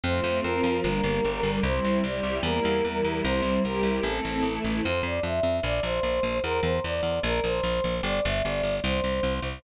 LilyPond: <<
  \new Staff \with { instrumentName = "Choir Aahs" } { \time 2/2 \key f \major \tempo 2 = 75 c''4 bes'4 bes'2 | c''4 d''4 bes'2 | c''4 bes'4 a'4. r8 | c''8 d''8 e''4 d''8 c''4. |
bes'8 c''8 d''4 bes'8 c''4. | d''8 e''8 d''4 c''4. r8 | }
  \new Staff \with { instrumentName = "String Ensemble 1" } { \time 2/2 \key f \major <f a c'>4 <f c' f'>4 <g bes d'>4 <d g d'>4 | <g c' e'>4 <g e' g'>4 <g bes e'>4 <e g e'>4 | <g c' e'>4 <g e' g'>4 <a c' e'>4 <e a e'>4 | r1 |
r1 | r1 | }
  \new Staff \with { instrumentName = "Electric Bass (finger)" } { \clef bass \time 2/2 \key f \major f,8 f,8 f,8 f,8 g,,8 g,,8 g,,8 g,,8 | c,8 c,8 c,8 c,8 e,8 e,8 e,8 e,8 | c,8 c,8 c,8 c,8 a,,8 a,,8 a,,8 a,,8 | f,8 f,8 f,8 f,8 bes,,8 bes,,8 bes,,8 bes,,8 |
e,8 e,8 e,8 e,8 bes,,8 bes,,8 bes,,8 bes,,8 | g,,8 g,,8 g,,8 g,,8 c,8 c,8 c,8 c,8 | }
>>